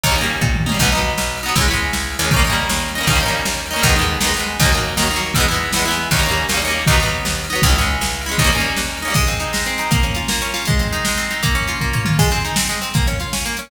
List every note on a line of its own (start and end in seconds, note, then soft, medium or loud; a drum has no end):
0.03 0.38 D#2 loud
0.03 0.15 C#4 medium
0.03 0.15 D#4 medium
0.03 kick loud
0.03 ride loud
0.09 0.15 G3 medium
0.09 0.15 A#3 medium
0.16 0.62 C#4 medium
0.16 0.62 D#4 medium
0.21 0.62 G3 medium
0.21 0.62 A#3 medium
0.21 ride medium
0.41 0.76 A#2 medium
0.41 kick loud
0.41 floor tom medium
0.55 mid tom medium
0.66 0.78 C#4 medium
0.66 0.78 D#4 medium
0.66 high tom medium
0.72 0.78 G3 medium
0.72 0.78 A#3 medium
0.79 1.14 B1 loud
0.79 0.91 B3 medium
0.79 0.91 D#4 medium
0.79 kick loud
0.79 crash loud
0.85 0.91 F#3 medium
0.92 1.39 B3 medium
0.92 1.39 D#4 medium
0.98 1.39 F#3 medium
0.98 ride medium
1.18 1.52 B1 medium
1.18 snare loud
1.37 ride medium
1.43 1.55 B3 medium
1.43 1.55 D#4 medium
1.48 1.55 F#3 medium
1.55 1.90 C#2 loud
1.55 1.67 C#4 medium
1.55 1.67 E4 medium
1.55 kick loud
1.55 ride loud
1.61 1.67 G#3 medium
1.68 2.15 C#4 medium
1.68 2.15 E4 medium
1.73 2.15 G#3 medium
1.73 ride medium
1.93 2.18 C#2 medium
1.93 snare loud
2.12 ride medium
2.19 2.66 D#2 loud
2.19 2.31 C#4 medium
2.19 2.31 E4 medium
2.24 2.31 G#3 medium
2.31 2.43 C#4 medium
2.31 2.43 D#4 medium
2.31 kick loud
2.31 ride loud
2.36 2.43 G3 medium
2.36 2.43 A#3 loud
2.44 2.91 C#4 medium
2.44 2.91 D#4 medium
2.50 2.91 G3 medium
2.50 2.91 A#3 medium
2.50 ride medium
2.69 3.03 D#2 medium
2.69 snare loud
2.88 ride medium
2.95 3.07 C#4 medium
2.95 3.07 D#4 medium
3.01 3.07 G3 medium
3.01 3.07 A#3 medium
3.07 3.41 D#2 loud
3.07 3.19 C#4 medium
3.07 3.19 D#4 medium
3.07 kick loud
3.07 ride loud
3.13 3.19 G3 medium
3.13 3.19 A#3 medium
3.20 3.67 C#4 medium
3.20 3.67 D#4 medium
3.25 3.67 G3 medium
3.25 3.67 A#3 medium
3.25 ride medium
3.45 3.80 D#2 medium
3.45 snare loud
3.66 ride medium
3.71 3.82 C#4 medium
3.71 3.82 D#4 medium
3.76 3.82 G3 medium
3.76 3.82 A#3 medium
3.82 4.17 D#2 loud
3.82 3.96 D#4 medium
3.82 kick loud
3.82 ride loud
3.86 3.96 G#3 medium
3.86 3.96 B3 medium
3.96 4.19 B3 medium
3.96 4.19 D#4 medium
4.01 4.19 G#3 medium
4.01 ride medium
4.21 4.55 D#2 medium
4.21 4.33 B3 medium
4.21 4.33 D#4 medium
4.21 snare loud
4.27 4.33 G#3 medium
4.34 4.57 B3 medium
4.34 4.57 D#4 medium
4.39 4.57 G#3 medium
4.39 ride medium
4.60 4.94 D#2 loud
4.60 4.72 A#3 medium
4.60 4.71 D#4 medium
4.60 kick loud
4.60 ride loud
4.65 4.72 F#3 medium
4.72 4.95 A#3 medium
4.72 4.95 D#4 medium
4.77 4.95 F#3 medium
4.77 ride medium
4.97 5.31 D#2 loud
4.97 5.09 A#3 medium
4.97 5.09 D#4 medium
4.97 snare loud
5.02 5.09 F#3 medium
5.11 5.34 A#3 medium
5.11 5.34 D#4 medium
5.16 5.34 F#3 medium
5.16 ride medium
5.34 5.70 E2 loud
5.34 5.47 B3 medium
5.34 5.47 E4 medium
5.34 kick loud
5.34 ride loud
5.40 5.47 G#3 loud
5.48 5.72 B3 medium
5.48 5.72 E4 medium
5.54 5.72 G#3 medium
5.54 ride medium
5.73 6.07 E2 medium
5.73 5.85 B3 medium
5.73 5.85 E4 medium
5.73 snare loud
5.79 5.85 G#3 medium
5.85 6.09 B3 medium
5.85 6.09 E4 medium
5.91 6.09 G#3 medium
5.91 ride medium
6.11 6.45 D#2 loud
6.11 6.23 C#4 medium
6.11 6.23 D#4 medium
6.11 kick loud
6.11 ride loud
6.16 6.23 G3 medium
6.16 6.23 A#3 medium
6.23 6.46 C#4 medium
6.23 6.46 D#4 medium
6.28 6.46 G3 medium
6.28 6.46 A#3 medium
6.28 ride medium
6.49 6.83 D#2 medium
6.49 6.60 C#4 medium
6.49 6.60 D#4 medium
6.49 snare loud
6.54 6.60 G3 medium
6.54 6.60 A#3 medium
6.62 6.85 C#4 medium
6.62 6.85 D#4 medium
6.67 6.85 G3 medium
6.67 6.85 A#3 medium
6.67 ride medium
6.87 7.22 D#2 loud
6.87 6.99 B3 medium
6.87 6.99 D#4 medium
6.87 kick loud
6.87 ride loud
6.93 6.99 F#3 medium
7.00 7.46 B3 medium
7.00 7.46 D#4 medium
7.05 7.46 F#3 medium
7.05 ride medium
7.25 7.59 D#2 medium
7.25 snare loud
7.44 ride medium
7.50 7.62 B3 medium
7.50 7.62 D#4 medium
7.55 7.62 F#3 medium
7.62 7.97 C#2 loud
7.62 7.75 E4 medium
7.62 kick loud
7.62 ride loud
7.66 7.75 G#3 medium
7.66 7.75 C#4 medium
7.76 8.22 C#4 medium
7.76 8.22 E4 medium
7.81 8.22 G#3 medium
7.81 ride medium
8.01 8.35 C#2 medium
8.01 snare loud
8.21 ride medium
8.26 8.38 C#4 medium
8.26 8.38 E4 medium
8.31 8.38 G#3 medium
8.38 8.73 D#2 loud
8.38 8.51 C#4 medium
8.38 8.51 D#4 medium
8.38 kick loud
8.38 ride loud
8.44 8.51 G3 medium
8.44 8.51 A#3 loud
8.52 8.99 C#4 medium
8.52 8.99 D#4 medium
8.58 8.99 G3 medium
8.58 8.99 A#3 medium
8.58 ride medium
8.76 9.11 D#2 medium
8.76 snare loud
8.97 ride medium
9.02 9.14 C#4 medium
9.02 9.14 D#4 medium
9.08 9.14 G3 medium
9.08 9.14 A#3 medium
9.14 9.52 G#3 loud
9.14 kick loud
9.14 crash loud
9.27 9.66 C4 medium
9.27 closed hi-hat medium
9.40 9.79 D#4 medium
9.40 closed hi-hat medium
9.53 9.89 G#3 medium
9.53 snare loud
9.66 9.90 C4 medium
9.66 closed hi-hat medium
9.78 9.91 D#4 medium
9.78 closed hi-hat medium
9.91 10.29 A#3 medium
9.91 kick loud
9.91 closed hi-hat loud
10.03 10.41 C#4 medium
10.03 closed hi-hat medium
10.15 10.54 F4 medium
10.15 closed hi-hat medium
10.28 10.65 A#3 medium
10.28 snare loud
10.42 10.66 C#4 medium
10.42 closed hi-hat medium
10.54 10.66 F4 medium
10.54 open hi-hat medium
10.65 11.05 G#3 medium
10.65 kick loud
10.65 closed hi-hat loud
10.79 11.17 C4 medium
10.79 closed hi-hat medium
10.93 11.30 D#4 medium
10.93 closed hi-hat medium
11.05 11.42 G#3 medium
11.05 snare loud
11.17 11.42 C4 medium
11.17 closed hi-hat medium
11.31 11.43 D#4 medium
11.31 closed hi-hat medium
11.43 11.81 A#3 loud
11.43 kick loud
11.43 closed hi-hat loud
11.55 11.93 C#4 medium
11.55 closed hi-hat medium
11.67 12.05 F4 medium
11.67 closed hi-hat medium
11.81 12.17 A#3 medium
11.81 kick medium
11.93 12.17 C#4 medium
11.93 floor tom loud
12.05 12.18 F4 medium
12.05 mid tom loud
12.19 12.30 G#3 loud
12.19 kick loud
12.19 crash loud
12.31 12.43 C4 medium
12.31 closed hi-hat medium
12.45 12.56 D#4 medium
12.45 closed hi-hat medium
12.56 12.68 C4 medium
12.56 snare loud
12.69 12.80 G#3 medium
12.69 closed hi-hat medium
12.82 12.93 C4 medium
12.82 closed hi-hat medium
12.94 13.06 A#3 loud
12.94 kick loud
12.94 closed hi-hat medium
13.07 13.19 C#4 medium
13.07 closed hi-hat medium
13.20 13.32 F4 medium
13.20 closed hi-hat medium
13.33 13.44 C#4 medium
13.33 snare loud
13.46 13.57 A#3 medium
13.46 closed hi-hat medium
13.57 13.70 C#4 medium
13.57 closed hi-hat medium